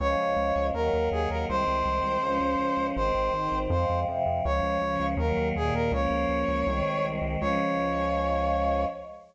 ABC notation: X:1
M:2/2
L:1/8
Q:1/2=81
K:Db
V:1 name="Brass Section"
d4 B2 A B | c8 | c4 c2 z2 | d4 B2 A B |
d7 z | d8 |]
V:2 name="Choir Aahs"
[F,A,D]4 [E,G,B,]4 | [E,A,C]4 [F,A,D]4 | [E,A,C]2 [E,CE]2 [F,A,C]2 [C,F,C]2 | [F,A,D]2 [D,F,D]2 [E,G,B,]2 [B,,E,B,]2 |
[F,B,D]4 [E,A,C]4 | [F,A,D]8 |]
V:3 name="Synth Bass 1" clef=bass
D,, D,, D,, D,, E,, E,, E,, E,, | C,, C,, C,, C,, D,, D,, D,, D,, | A,,, A,,, A,,, A,,, F,, F,, F,, F,, | D,, D,, D,, D,, E,, E,, E,, E,, |
D,, D,, D,, D,, C,, C,, C,, C,, | D,,8 |]